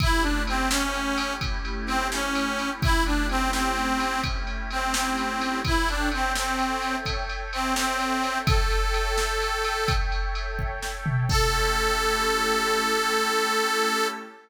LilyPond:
<<
  \new Staff \with { instrumentName = "Harmonica" } { \time 12/8 \key a \major \tempo 4. = 85 e'8 d'8 bis8 cis'4. r4 bis8 cis'4. | e'8 d'8 c'8 c'4. r4 c'8 c'4. | e'8 d'8 c'8 c'4. r4 c'8 c'4. | a'2.~ a'8 r2 r8 |
a'1. | }
  \new Staff \with { instrumentName = "Pad 5 (bowed)" } { \time 12/8 \key a \major <a cis' e' g'>1.~ | <a cis' e' g'>1. | <a' cis'' e'' g''>1.~ | <a' cis'' e'' g''>1. |
<a cis' e' g'>1. | }
  \new DrumStaff \with { instrumentName = "Drums" } \drummode { \time 12/8 <bd cymr>8 cymr8 cymr8 sn8 cymr8 cymr8 <bd cymr>8 cymr8 cymr8 sn8 cymr8 cymr8 | <bd cymr>8 cymr8 cymr8 sn8 cymr8 cymr8 <bd cymr>8 cymr8 cymr8 sn8 cymr8 cymr8 | <bd cymr>8 cymr8 cymr8 sn8 cymr8 cymr8 <bd cymr>8 cymr8 cymr8 sn8 cymr8 cymr8 | <bd cymr>8 cymr8 cymr8 sn8 cymr8 cymr8 <bd cymr>8 cymr8 cymr8 bd8 sn8 tomfh8 |
<cymc bd>4. r4. r4. r4. | }
>>